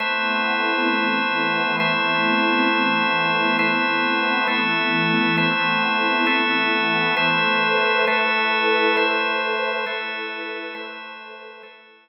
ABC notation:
X:1
M:6/8
L:1/8
Q:3/8=67
K:Ador
V:1 name="Pad 5 (bowed)"
[A,B,CE]3 [E,A,B,E]3 | [A,B,CE]3 [E,A,B,E]3 | [A,B,CE]3 [E,A,B,E]3 | [A,B,CE]3 [E,A,B,E]3 |
[ABce]3 [EABe]3 | [ABce]3 [EABe]3 | [ABce]3 [EABe]3 |]
V:2 name="Drawbar Organ"
[A,Bce]6 | [A,Bce]6 | [A,Bce]3 [A,ABe]3 | [A,Bce]3 [A,ABe]3 |
[A,Bce]3 [A,ABe]3 | [A,Bce]3 [A,ABe]3 | [A,Bce]3 [A,ABe]3 |]